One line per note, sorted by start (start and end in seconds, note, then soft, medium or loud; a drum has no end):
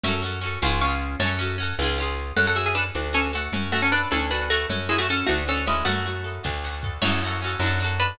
0.03 0.57 F#2 loud
0.03 0.21 C#4 loud
0.03 0.22 F#4 loud
0.03 0.41 E5 loud
0.03 0.41 C#6 loud
0.03 low conga medium
0.03 shaker medium
0.08 0.22 A4 medium
0.22 0.40 C#4 medium
0.22 0.40 F#4 medium
0.22 shaker medium
0.26 0.40 A4 medium
0.41 0.59 C#4 medium
0.41 0.59 F#4 medium
0.41 shaker soft
0.46 0.59 A4 medium
0.62 1.16 C#2 loud
0.62 0.80 C#4 loud
0.62 0.80 F4 loud
0.62 0.80 F5 medium
0.62 0.80 C#6 medium
0.62 tambourine medium
0.62 high conga medium
0.62 shaker medium
0.66 0.80 G#4 loud
0.81 1.18 C#4 loud
0.81 1.18 F4 medium
0.81 1.19 F5 loud
0.81 1.19 C#6 loud
0.81 shaker medium
0.87 1.18 G#4 medium
1.01 shaker medium
1.20 1.73 F#2 loud
1.20 1.38 C#4 loud
1.20 1.38 F#4 loud
1.20 1.56 C#5 medium
1.20 1.56 A5 loud
1.20 low conga medium
1.20 shaker medium
1.24 1.38 A4 loud
1.39 1.57 C#4 medium
1.39 1.57 F#4 medium
1.39 shaker medium
1.43 1.57 A4 medium
1.58 1.76 C#4 medium
1.58 1.76 F#4 medium
1.58 shaker medium
1.62 1.76 A4 medium
1.78 2.32 C#2 loud
1.78 1.97 C#4 medium
1.78 1.98 F4 loud
1.78 tambourine medium
1.78 high conga medium
1.78 shaker medium
1.84 1.98 G#4 loud
1.98 2.34 C#4 medium
1.98 2.34 F4 medium
1.98 shaker medium
2.02 2.34 G#4 medium
2.17 shaker medium
2.36 2.91 F#2 medium
2.36 2.92 C#4 medium
2.36 2.46 A4 loud
2.36 2.46 F#5 loud
2.36 low conga medium
2.36 shaker medium
2.47 2.56 A4 medium
2.47 2.56 F#5 loud
2.55 2.92 F#4 medium
2.55 2.65 G#4 medium
2.55 2.65 E5 medium
2.55 shaker medium
2.66 2.75 G#4 medium
2.66 2.75 E5 medium
2.75 2.84 D4 medium
2.75 2.95 A4 medium
2.75 2.84 B4 medium
2.75 shaker medium
2.95 3.49 D2 medium
2.95 3.50 D4 medium
2.95 tambourine medium
2.95 high conga medium
2.95 shaker medium
3.13 3.31 C#4 medium
3.13 3.50 F#4 medium
3.13 3.31 A4 loud
3.13 shaker medium
3.33 3.52 A3 medium
3.33 3.52 F#4 medium
3.33 3.52 A4 medium
3.33 shaker medium
3.52 4.06 F#2 medium
3.52 4.09 C#4 medium
3.52 low conga medium
3.52 shaker medium
3.72 3.81 A3 loud
3.72 3.81 F#4 loud
3.72 4.10 F#4 medium
3.72 shaker medium
3.82 3.91 C#4 medium
3.82 3.91 A4 medium
3.92 4.09 D4 medium
3.92 4.11 A4 medium
3.92 4.09 B4 loud
3.92 shaker soft
4.11 4.66 D2 medium
4.11 4.30 C#4 medium
4.11 4.66 D4 medium
4.11 4.30 A4 loud
4.11 tambourine medium
4.11 high conga medium
4.11 shaker medium
4.31 4.49 D4 medium
4.31 4.68 F#4 medium
4.31 4.49 B4 medium
4.31 shaker medium
4.50 4.67 A3 medium
4.50 4.67 F#4 medium
4.50 4.69 A4 medium
4.50 shaker medium
4.69 5.23 F#2 medium
4.69 5.25 C#4 medium
4.69 low conga medium
4.69 shaker medium
4.89 4.98 G#3 loud
4.89 4.98 E4 loud
4.89 5.27 F#4 medium
4.89 shaker soft
4.98 5.08 A3 medium
4.98 5.08 F#4 loud
5.09 5.27 C#4 medium
5.09 5.28 A4 medium
5.09 5.27 A4 medium
5.09 shaker medium
5.26 5.83 D2 medium
5.26 5.43 A3 medium
5.26 5.84 D4 loud
5.26 5.43 F#4 loud
5.26 tambourine medium
5.26 high conga medium
5.26 shaker medium
5.48 5.64 C#4 loud
5.48 5.85 F#4 medium
5.48 5.64 A4 loud
5.48 shaker medium
5.66 5.85 G#3 medium
5.66 6.41 C#4 loud
5.66 5.85 E4 loud
5.66 shaker medium
5.85 6.39 F#2 medium
5.85 6.56 A3 loud
5.85 6.56 F#4 loud
5.85 low conga medium
5.85 shaker medium
6.06 6.43 F#4 medium
6.06 shaker medium
6.24 6.43 A4 medium
6.24 shaker medium
6.44 6.99 D2 medium
6.44 6.99 D4 medium
6.44 kick medium
6.44 snare medium
6.64 7.01 F#4 medium
6.64 snare medium
6.83 7.02 A4 medium
6.83 floor tom medium
7.02 7.56 F#2 medium
7.02 7.21 C#4 loud
7.02 7.53 E4 loud
7.02 7.21 F#4 medium
7.02 7.53 C#5 loud
7.02 crash medium
7.02 low conga medium
7.02 shaker medium
7.07 7.21 A4 medium
7.22 7.40 C#4 medium
7.22 7.40 F#4 medium
7.22 shaker medium
7.27 7.40 A4 medium
7.42 7.60 C#4 medium
7.42 7.60 F#4 medium
7.42 shaker medium
7.46 7.60 A4 medium
7.60 8.13 F#2 loud
7.60 7.79 D4 loud
7.60 tambourine medium
7.60 high conga medium
7.60 shaker medium
7.64 7.79 F#4 loud
7.64 7.79 A4 loud
7.80 8.16 D4 medium
7.80 8.16 F#4 medium
7.80 shaker medium
7.84 8.16 A4 medium
8.00 8.18 D4 medium
8.00 8.18 B4 medium
8.00 shaker medium